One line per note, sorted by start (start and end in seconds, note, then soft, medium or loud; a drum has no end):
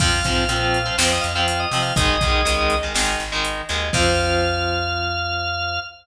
0.00 0.21 F2 medium
0.00 0.20 F3 medium
0.00 0.20 C4 medium
0.00 0.97 F5 medium
0.00 kick loud
0.00 crash loud
0.24 0.46 G#2 medium
0.24 0.44 F3 medium
0.24 0.44 C4 medium
0.24 kick medium
0.24 closed hi-hat medium
0.49 0.91 A#2 medium
0.49 0.78 F3 medium
0.49 0.78 C4 medium
0.49 closed hi-hat loud
0.74 closed hi-hat medium
0.86 0.95 F3 medium
0.86 0.95 C4 medium
0.98 1.20 F2 medium
0.98 1.27 F3 medium
0.98 1.27 C4 medium
0.98 1.11 C5 medium
0.98 snare loud
1.12 1.24 D#5 medium
1.21 1.66 F2 medium
1.21 1.33 F5 medium
1.21 closed hi-hat medium
1.35 1.65 F3 medium
1.35 1.65 C4 medium
1.35 1.47 F5 medium
1.48 1.60 F5 medium
1.48 closed hi-hat loud
1.60 1.82 D#5 medium
1.71 1.92 C3 medium
1.71 1.93 F3 medium
1.71 1.93 C4 medium
1.71 open hi-hat medium
1.82 1.94 F5 medium
1.96 2.17 G#1 medium
1.96 2.16 D#3 medium
1.96 2.16 G#3 loud
1.96 2.76 D#5 loud
1.96 kick loud
1.96 closed hi-hat loud
2.21 2.43 B1 medium
2.21 2.41 D#3 medium
2.21 2.41 G#3 medium
2.21 kick loud
2.21 closed hi-hat medium
2.45 2.88 C#2 medium
2.45 2.75 D#3 medium
2.45 2.75 G#3 medium
2.45 closed hi-hat loud
2.70 closed hi-hat medium
2.83 2.93 D#3 medium
2.83 2.93 G#3 medium
2.94 3.16 G#1 medium
2.94 3.24 D#3 medium
2.94 3.24 G#3 medium
2.94 snare loud
3.20 3.62 G#1 medium
3.20 closed hi-hat medium
3.32 3.62 D#3 medium
3.32 3.62 G#3 medium
3.45 closed hi-hat loud
3.69 3.91 D#2 medium
3.69 3.89 D#3 medium
3.69 3.89 G#3 medium
3.69 closed hi-hat medium
3.93 5.79 F2 loud
3.93 5.78 F3 loud
3.93 5.78 C4 loud
3.93 5.80 F5 loud
3.93 kick loud
3.93 crash loud